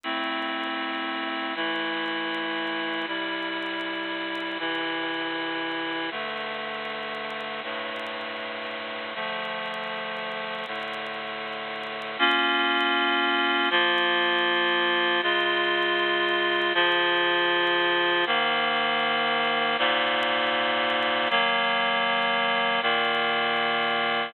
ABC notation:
X:1
M:4/4
L:1/8
Q:1/4=79
K:Am
V:1 name="Clarinet"
[A,CE]4 [E,A,E]4 | [C,G,E]4 [C,E,E]4 | [G,,D,A,]4 [G,,A,,A,]4 | [D,F,A,]4 [A,,D,A,]4 |
[K:Bbm] [B,DF]4 [F,B,F]4 | [D,A,F]4 [D,F,F]4 | [A,,E,B,]4 [A,,B,,B,]4 | [E,G,B,]4 [B,,E,B,]4 |]